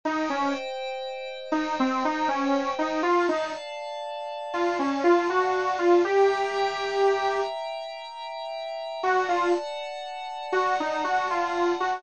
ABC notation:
X:1
M:3/4
L:1/16
Q:1/4=60
K:Ebdor
V:1 name="Lead 2 (sawtooth)"
E D z4 E C E D2 E | F E z4 F D F G2 F | =G6 z6 | ^F ^E z4 F _E F ^E2 F |]
V:2 name="Pad 5 (bowed)"
[ce=g]12 | [=df=a]12 | [=e=gb]12 | [=d^f=a]12 |]